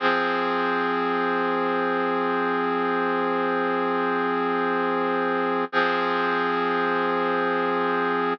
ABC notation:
X:1
M:4/4
L:1/8
Q:1/4=84
K:Fm
V:1 name="Brass Section"
[F,CA]8- | [F,CA]8 | [F,CA]8 |]